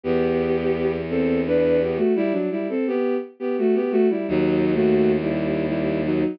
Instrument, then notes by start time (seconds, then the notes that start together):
violin
0.04 E2 B3 G4
1.10 C4 A4
1.46 D4 B4
1.82 B3 G4
1.97 A3 F#4
2.16 G3 E4
2.32 F#3 D4
2.51 G3 E4
2.69 C4 A4
2.87 B3 G4
3.40 B3 G4
3.58 A3 F#4
3.75 B3 G4
3.91 A3 F#4
4.10 G3 E4
4.28 D#2 F#3 D#4
4.75 A3 F#4
5.21 G3 E4
5.68 G3 E4
6.05 F#3 D#4